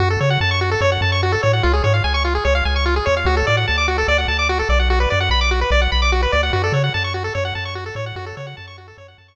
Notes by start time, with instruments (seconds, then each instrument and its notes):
0.00 synth bass 1 F#2, lead 1 (square) F#4
0.10 lead 1 (square) A4
0.21 synth bass 1 C#3, lead 1 (square) C#5
0.30 lead 1 (square) F#5
0.41 synth bass 1 F#2, lead 1 (square) A5
0.51 lead 1 (square) C#6
0.61 lead 1 (square) F#4
0.71 lead 1 (square) A4
0.81 synth bass 1 F#2, lead 1 (square) C#5
0.92 lead 1 (square) F#5
1.01 synth bass 1 F#2, lead 1 (square) A5
1.12 lead 1 (square) C#6
1.23 lead 1 (square) F#4
1.32 lead 1 (square) A4
1.43 synth bass 1 A2, lead 1 (square) C#5
1.53 lead 1 (square) F#5
1.63 synth bass 1 C#2, lead 1 (square) F4
1.73 lead 1 (square) G#4
1.84 synth bass 1 G#2, lead 1 (square) C#5
1.94 lead 1 (square) F5
2.04 synth bass 1 C#2, lead 1 (square) G#5
2.14 lead 1 (square) C#6
2.25 lead 1 (square) F4
2.35 lead 1 (square) G#4
2.45 synth bass 1 C#2, lead 1 (square) C#5
2.55 lead 1 (square) F5
2.65 synth bass 1 C#2, lead 1 (square) G#5
2.76 lead 1 (square) C#6
2.86 lead 1 (square) F4
2.96 lead 1 (square) G#4
3.06 synth bass 1 E2, lead 1 (square) C#5
3.17 lead 1 (square) F5
3.25 synth bass 1 D2, lead 1 (square) F#4
3.37 lead 1 (square) A4
3.47 synth bass 1 A2, lead 1 (square) D5
3.57 lead 1 (square) F#5
3.68 synth bass 1 D2, lead 1 (square) A5
3.78 lead 1 (square) D6
3.88 lead 1 (square) F#4
3.98 lead 1 (square) A4
4.08 synth bass 1 D2, lead 1 (square) D5
4.18 lead 1 (square) F#5
4.28 synth bass 1 D2, lead 1 (square) A5
4.39 lead 1 (square) D6
4.49 lead 1 (square) F#4
4.59 lead 1 (square) A4
4.69 synth bass 1 B1, lead 1 (square) D5
4.79 lead 1 (square) F#5
4.90 lead 1 (square) F#4
5.00 lead 1 (square) B4
5.10 synth bass 1 F#2, lead 1 (square) D5
5.20 lead 1 (square) F#5
5.29 synth bass 1 B1, lead 1 (square) B5
5.41 lead 1 (square) D6
5.51 lead 1 (square) F#4
5.61 lead 1 (square) B4
5.71 synth bass 1 B1, lead 1 (square) D5
5.81 lead 1 (square) F#5
5.92 synth bass 1 B1, lead 1 (square) B5
6.02 lead 1 (square) D6
6.12 lead 1 (square) F#4
6.23 lead 1 (square) B4
6.32 synth bass 1 D2, lead 1 (square) D5
6.43 lead 1 (square) F#5
6.53 synth bass 1 F#2, lead 1 (square) F#4
6.64 lead 1 (square) A4
6.72 synth bass 1 C#3, lead 1 (square) C#5
6.84 lead 1 (square) F#5
6.94 synth bass 1 F#2, lead 1 (square) A5
7.04 lead 1 (square) C#6
7.14 lead 1 (square) F#4
7.24 lead 1 (square) A4
7.35 synth bass 1 F#2, lead 1 (square) C#5
7.45 lead 1 (square) F#5
7.55 synth bass 1 F#2, lead 1 (square) A5
7.65 lead 1 (square) C#6
7.75 lead 1 (square) F#4
7.86 lead 1 (square) A4
7.95 synth bass 1 A2, lead 1 (square) C#5
8.06 lead 1 (square) F#5
8.16 synth bass 1 F#2, lead 1 (square) F#4
8.26 lead 1 (square) A4
8.37 synth bass 1 C#3, lead 1 (square) C#5
8.47 lead 1 (square) F#5
8.57 synth bass 1 F#2, lead 1 (square) A5
8.67 lead 1 (square) C#6
8.78 lead 1 (square) F#4
8.88 lead 1 (square) A4
8.98 synth bass 1 F#2, lead 1 (square) C#5
9.08 lead 1 (square) F#5
9.18 synth bass 1 F#2, lead 1 (square) A5
9.28 lead 1 (square) C#6